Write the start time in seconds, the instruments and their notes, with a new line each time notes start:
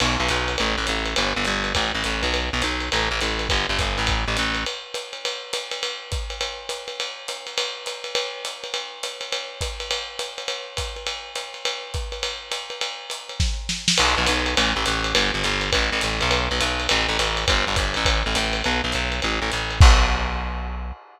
0.00 electric bass (finger) B1, crash, ride
0.20 electric bass (finger) B1
0.29 electric bass (finger) B1, hi-hat pedal, ride
0.48 ride
0.58 electric bass (finger) A1, ride
0.78 electric bass (finger) A1
0.87 electric bass (finger) A1, hi-hat pedal, ride
1.05 ride
1.16 electric bass (finger) G1, ride
1.36 electric bass (finger) G1
1.45 electric bass (finger) G1, hi-hat pedal, ride
1.64 ride
1.75 electric bass (finger) A1, kick, ride
1.95 electric bass (finger) A1
2.04 electric bass (finger) A1, hi-hat pedal, ride
2.23 electric bass (finger) B1, ride
2.34 ride
2.53 electric bass (finger) B1
2.62 electric bass (finger) B1, hi-hat pedal, ride
2.80 ride
2.92 electric bass (finger) A1, ride
3.11 electric bass (finger) A1
3.21 electric bass (finger) A1, hi-hat pedal, ride
3.39 ride
3.49 electric bass (finger) G1, kick, ride
3.69 electric bass (finger) G1
3.79 electric bass (finger) G1, kick, hi-hat pedal, ride
3.98 electric bass (finger) A1, ride
4.07 kick, ride
4.28 electric bass (finger) A1
4.37 electric bass (finger) A1, hi-hat pedal, ride
4.55 ride
4.66 ride
4.94 hi-hat pedal, ride
5.13 ride
5.25 ride
5.53 hi-hat pedal, ride
5.71 ride
5.83 ride
6.12 kick, hi-hat pedal, ride
6.30 ride
6.41 ride
6.69 hi-hat pedal, ride
6.88 ride
7.00 ride
7.28 hi-hat pedal, ride
7.47 ride
7.58 ride
7.86 hi-hat pedal, ride
8.04 ride
8.15 ride
8.45 hi-hat pedal, ride
8.64 ride
8.74 ride
9.03 hi-hat pedal, ride
9.21 ride
9.32 ride
9.61 kick, hi-hat pedal, ride
9.80 ride
9.91 ride
10.19 hi-hat pedal, ride
10.38 ride
10.48 ride
10.77 kick, hi-hat pedal, ride
10.96 ride
11.07 ride
11.35 hi-hat pedal, ride
11.54 ride
11.65 ride
11.94 kick, hi-hat pedal, ride
12.12 ride
12.23 ride
12.52 hi-hat pedal, ride
12.70 ride
12.81 ride
13.10 hi-hat pedal, ride
13.29 ride
13.40 kick, snare
13.69 snare
13.88 snare
13.98 electric bass (finger) B1, crash, ride
14.18 electric bass (finger) B1
14.26 electric bass (finger) B1, hi-hat pedal, ride
14.46 ride
14.57 electric bass (finger) A1, ride
14.76 electric bass (finger) A1
14.86 electric bass (finger) A1, hi-hat pedal, ride
15.04 ride
15.15 electric bass (finger) G1, ride
15.34 electric bass (finger) G1
15.44 electric bass (finger) G1, hi-hat pedal, ride
15.61 ride
15.73 electric bass (finger) A1, kick, ride
15.92 electric bass (finger) A1
16.01 electric bass (finger) A1, hi-hat pedal, ride
16.21 electric bass (finger) B1, ride
16.31 ride
16.51 electric bass (finger) B1
16.60 electric bass (finger) B1, hi-hat pedal, ride
16.80 ride
16.89 electric bass (finger) A1, ride
17.09 electric bass (finger) A1
17.19 electric bass (finger) A1, hi-hat pedal, ride
17.37 ride
17.48 electric bass (finger) G1, kick, ride
17.67 electric bass (finger) G1
17.76 electric bass (finger) G1, kick, hi-hat pedal, ride
17.94 electric bass (finger) A1, ride
18.05 kick, ride
18.26 electric bass (finger) A1
18.35 electric bass (finger) A1, hi-hat pedal, ride
18.53 ride
18.64 electric bass (finger) B1, ride
18.84 electric bass (finger) B1
18.92 electric bass (finger) B1, hi-hat pedal, ride
19.12 ride
19.22 electric bass (finger) A1, ride
19.42 electric bass (finger) A1
19.52 electric bass (finger) A1, hi-hat pedal, ride
19.71 ride
19.81 electric bass (finger) B1, kick, crash